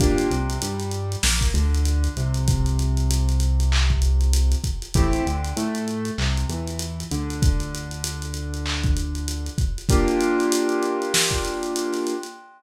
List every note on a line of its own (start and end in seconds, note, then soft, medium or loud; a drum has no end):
0.00 0.27 G1 medium
0.00 0.29 A#3 medium
0.00 0.29 D4 medium
0.00 0.29 F4 medium
0.00 0.29 G4 medium
0.00 kick loud
0.00 closed hi-hat loud
0.18 closed hi-hat medium
0.31 0.58 C2 medium
0.31 0.58 C3 medium
0.31 closed hi-hat medium
0.50 closed hi-hat medium
0.62 1.16 G2 medium
0.62 1.16 G3 medium
0.62 closed hi-hat loud
0.80 closed hi-hat medium
0.91 closed hi-hat medium
1.12 closed hi-hat medium
1.23 1.51 A#1 medium
1.23 1.51 A#3 medium
1.23 snare loud
1.41 kick medium
1.41 closed hi-hat medium
1.54 2.08 D2 medium
1.54 2.09 D3 medium
1.54 closed hi-hat medium
1.74 closed hi-hat medium
1.85 closed hi-hat loud
2.04 closed hi-hat medium
2.16 4.55 C2 medium
2.16 4.56 C3 medium
2.16 closed hi-hat medium
2.34 closed hi-hat medium
2.48 kick loud
2.48 closed hi-hat loud
2.66 closed hi-hat medium
2.79 closed hi-hat medium
2.97 closed hi-hat medium
3.11 closed hi-hat loud
3.29 closed hi-hat medium
3.40 closed hi-hat loud
3.60 closed hi-hat medium
3.72 clap loud
3.90 kick medium
4.02 closed hi-hat loud
4.21 closed hi-hat medium
4.33 closed hi-hat loud
4.52 closed hi-hat medium
4.64 kick medium
4.64 closed hi-hat loud
4.82 closed hi-hat medium
4.94 5.22 A1 medium
4.94 5.24 A3 medium
4.94 5.24 C4 medium
4.94 5.24 E4 medium
4.94 5.24 G4 medium
4.94 kick loud
4.94 closed hi-hat loud
5.13 closed hi-hat medium
5.26 5.53 D2 medium
5.26 5.53 D3 medium
5.26 closed hi-hat medium
5.44 closed hi-hat medium
5.56 6.11 A2 medium
5.56 6.11 A3 medium
5.56 closed hi-hat loud
5.75 closed hi-hat medium
5.88 closed hi-hat medium
6.05 closed hi-hat medium
6.18 6.45 C2 medium
6.18 6.46 C3 medium
6.18 clap loud
6.37 closed hi-hat medium
6.49 7.04 E2 medium
6.49 7.04 E3 medium
6.49 closed hi-hat medium
6.67 closed hi-hat medium
6.79 closed hi-hat loud
7.00 closed hi-hat medium
7.11 9.50 D2 medium
7.11 9.50 D3 medium
7.11 closed hi-hat loud
7.30 closed hi-hat medium
7.42 kick loud
7.42 closed hi-hat loud
7.60 closed hi-hat medium
7.75 closed hi-hat loud
7.91 closed hi-hat medium
8.04 closed hi-hat loud
8.22 closed hi-hat medium
8.34 closed hi-hat medium
8.54 closed hi-hat medium
8.66 clap loud
8.84 kick loud
8.84 closed hi-hat medium
8.97 closed hi-hat medium
9.15 closed hi-hat medium
9.28 closed hi-hat loud
9.46 closed hi-hat medium
9.58 kick loud
9.58 closed hi-hat medium
9.78 closed hi-hat medium
9.89 12.14 A#3 medium
9.89 12.14 D4 medium
9.89 12.14 F4 medium
9.89 12.14 G4 medium
9.89 kick loud
9.89 closed hi-hat loud
10.08 closed hi-hat medium
10.20 closed hi-hat loud
10.40 closed hi-hat medium
10.52 closed hi-hat loud
10.69 closed hi-hat medium
10.83 closed hi-hat medium
11.02 closed hi-hat medium
11.14 snare loud
11.31 kick medium
11.31 closed hi-hat medium
11.45 closed hi-hat medium
11.63 closed hi-hat medium
11.76 closed hi-hat loud
11.93 snare soft
11.93 closed hi-hat medium
12.07 closed hi-hat medium
12.23 closed hi-hat medium